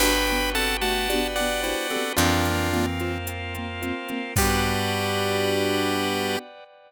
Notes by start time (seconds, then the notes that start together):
0.00 G1 B3 D4 F#4 G4 B4 G5 B5, crash
0.05 B3
0.27 D4 F#4 G4 G5, closed hi-hat
0.32 B3
0.54 C4 D4 F#4 G4 A4 B4 F#5 A5, closed hi-hat
0.59 B3
0.81 A3 D4 F#4 G4 F#5 A5, closed hi-hat
0.86 B3
1.09 D4 F#4 G4 B4 D5, closed hi-hat
1.15 B3
1.36 D4 F#4 G4 D5 F#5 G5, closed hi-hat
1.41 B3
1.63 D4 E4 F#4 G4 C5 F#5, closed hi-hat
1.69 B3
1.90 C4 F#4 G4 A4 B4, closed hi-hat
1.95 B3 D4
2.16 F2 E3 A#3 C4 D4 F4 A#4, closed hi-hat
2.21 A#3
2.45 C4 F4 F5, closed hi-hat
2.49 A#3
2.72 E3 C4 F4 A#4, closed hi-hat
2.76 A#3
2.99 C4 F4 C5, closed hi-hat
3.04 A#3
3.27 A#3 C4 F4 A#4, closed hi-hat
3.54 C4 F4 F5, closed hi-hat
3.58 A#3
3.81 A#3 C4 F4 C5, closed hi-hat
4.08 A#3 C4 F4 A#4, closed hi-hat
4.36 G2 G3 B3 D4 F#4 G4 B4 D5 F#5 G5, kick, crash
4.41 B3